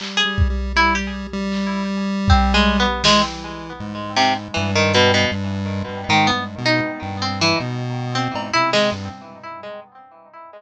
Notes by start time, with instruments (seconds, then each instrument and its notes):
0.00 lead 1 (square) G3, clap
0.17 harpsichord G#4
0.25 lead 1 (square) G3
0.38 kick
0.50 lead 1 (square) G3
0.76 lead 1 (square) G3, harpsichord E4
0.95 harpsichord G4
1.33 lead 1 (square) G3
1.52 clap
2.28 harpsichord C4, kick
2.54 harpsichord G#3
2.80 harpsichord B3
3.04 lead 1 (square) E3, harpsichord G#3, snare
3.80 lead 1 (square) G#2
4.16 harpsichord C3, clap
4.54 lead 1 (square) G2, harpsichord E3
4.75 harpsichord D#3
4.94 harpsichord B2, closed hi-hat
5.14 harpsichord B2
5.31 lead 1 (square) G2
5.88 lead 1 (square) G2
6.09 lead 1 (square) G#2, harpsichord D#3
6.27 harpsichord B3
6.33 lead 1 (square) G2
6.58 lead 1 (square) B2
6.66 harpsichord D#4
7.02 lead 1 (square) G2
7.22 harpsichord C4
7.41 harpsichord E3
7.60 lead 1 (square) B2
8.15 harpsichord C4
8.34 lead 1 (square) G#2, cowbell
8.53 lead 1 (square) C3, harpsichord E4
8.73 harpsichord G#3, snare
8.92 lead 1 (square) G2